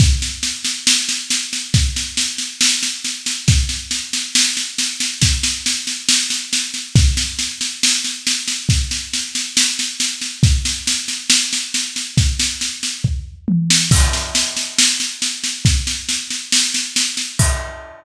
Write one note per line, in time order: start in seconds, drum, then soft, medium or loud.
0.00 kick loud
0.00 snare medium
0.22 snare medium
0.43 snare medium
0.64 snare medium
0.87 snare loud
1.09 snare medium
1.30 snare loud
1.53 snare medium
1.74 kick loud
1.74 snare medium
1.96 snare medium
2.17 snare loud
2.38 snare medium
2.61 snare loud
2.83 snare medium
3.05 snare medium
3.26 snare medium
3.48 kick loud
3.48 snare loud
3.69 snare medium
3.91 snare medium
4.13 snare medium
4.35 snare loud
4.57 snare medium
4.78 snare loud
5.00 snare medium
5.22 kick loud
5.22 snare loud
5.43 snare loud
5.66 snare loud
5.87 snare medium
6.09 snare loud
6.30 snare medium
6.53 snare loud
6.74 snare medium
6.95 kick loud
6.95 snare loud
7.17 snare medium
7.39 snare medium
7.61 snare medium
7.83 snare loud
8.04 snare medium
8.27 snare loud
8.48 snare medium
8.69 kick loud
8.69 snare medium
8.91 snare medium
9.13 snare medium
9.35 snare medium
9.57 snare loud
9.79 snare medium
10.00 snare loud
10.21 snare medium
10.43 kick loud
10.43 snare medium
10.65 snare medium
10.87 snare loud
11.08 snare medium
11.30 snare loud
11.53 snare medium
11.74 snare medium
11.96 snare medium
12.17 kick loud
12.17 snare medium
12.39 snare loud
12.61 snare medium
12.83 snare medium
13.04 kick medium
13.04 floor tom medium
13.48 high tom loud
13.70 snare loud
13.91 kick loud
13.91 snare loud
13.91 crash loud
14.13 snare medium
14.35 snare loud
14.57 snare medium
14.78 snare loud
15.00 snare medium
15.22 snare medium
15.44 snare medium
15.65 kick loud
15.65 snare medium
15.87 snare medium
16.09 snare medium
16.30 snare medium
16.52 snare loud
16.74 snare medium
16.96 snare loud
17.17 snare medium
17.39 kick loud
17.39 crash loud